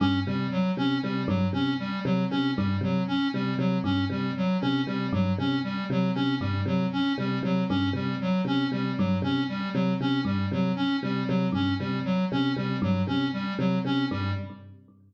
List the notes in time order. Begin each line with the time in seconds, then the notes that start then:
0.00 G2 C#4
0.27 C3 G3
0.51 F#3
0.77 C3 C#4
1.02 C3 G3
1.27 G2 F#3
1.53 C3 C#4
1.79 G3
2.04 C3 F#3
2.30 C3 C#4
2.56 G2 G3
2.81 C3 F#3
3.08 C#4
3.34 C3 G3
3.58 C3 F#3
3.84 G2 C#4
4.10 C3 G3
4.37 F#3
4.61 C3 C#4
4.87 C3 G3
5.13 G2 F#3
5.38 C3 C#4
5.64 G3
5.90 C3 F#3
6.15 C3 C#4
6.40 G2 G3
6.65 C3 F#3
6.93 C#4
7.18 C3 G3
7.43 C3 F#3
7.69 G2 C#4
7.93 C3 G3
8.21 F#3
8.45 C3 C#4
8.72 C3 G3
8.97 G2 F#3
9.22 C3 C#4
9.49 G3
9.74 C3 F#3
10.00 C3 C#4
10.25 G2 G3
10.51 C3 F#3
10.76 C#4
11.03 C3 G3
11.27 C3 F#3
11.52 G2 C#4
11.79 C3 G3
12.05 F#3
12.32 C3 C#4
12.56 C3 G3
12.82 G2 F#3
13.07 C3 C#4
13.33 G3
13.58 C3 F#3
13.85 C3 C#4
14.11 G2 G3